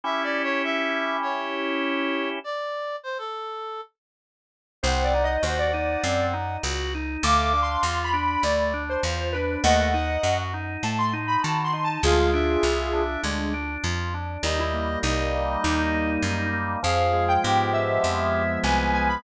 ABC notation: X:1
M:4/4
L:1/16
Q:1/4=100
K:Dm
V:1 name="Lead 1 (square)"
z16 | z16 | [K:Em] (3c2 d2 _e2 c d5 z6 | (3d'4 c'4 b4 d3 c3 B2 |
[^df]6 z2 a c' z b (3a2 c'2 a2 | [=F_A]8 D4 z4 | ^D E2 z5 D6 z2 | =f3 g3 e6 _a2 a _c' |]
V:2 name="Clarinet"
(3e2 d2 ^c2 e4 c8 | d4 c A5 z6 | [K:Em] _g4 g8 z4 | =f2 f4 z10 |
f2 f4 z10 | =f2 e6 z8 | ^d4 d8 z4 | _A4 G8 _c4 |]
V:3 name="Drawbar Organ"
[^CEG]16 | z16 | [K:Em] C2 _E2 _G2 E2 C2 E2 G2 E2 | A,2 D2 =F2 D2 A,2 D2 F2 D2 |
A,2 ^D2 F2 D2 A,2 D2 F2 D2 | _A,2 D2 =F2 D2 A,2 D2 F2 D2 | G,2 ^A,2 ^D2 A,2 G,2 A,2 D2 A,2 | =F,2 _A,2 _C2 A,2 F,2 A,2 C2 A,2 |]
V:4 name="Electric Bass (finger)" clef=bass
z16 | z16 | [K:Em] C,,4 _E,,4 _G,,4 ^C,,4 | D,,4 E,,4 D,,4 E,,4 |
^D,,4 F,,4 A,,4 ^D,4 | D,,4 C,,4 D,,4 =F,,4 | ^D,,4 C,,4 D,,4 F,,4 | =F,,4 _A,,4 F,,4 C,,4 |]